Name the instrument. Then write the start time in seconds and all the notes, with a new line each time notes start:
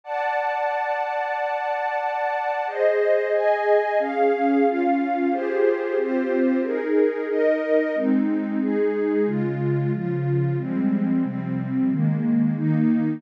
pad 2 (warm)
0.04 D5 F#5 A5
2.67 G#4 C5 D#5
3.33 G#4 D#5 G#5
3.99 C#4 G#4 F5
4.65 C#4 F4 F5
5.31 F4 G4 G#4 C5
5.97 C4 F4 G4 C5
6.63 D#4 G#4 A#4
7.29 D#4 A#4 D#5
7.95 G#3 C4 D#4
8.61 G#3 D#4 G#4
9.27 C#3 G#3 F4
9.93 C#3 F3 F4
10.58 F3 G3 G#3 C4
11.24 C3 F3 G3 C4
11.90 D#3 G#3 A#3
12.56 D#3 A#3 D#4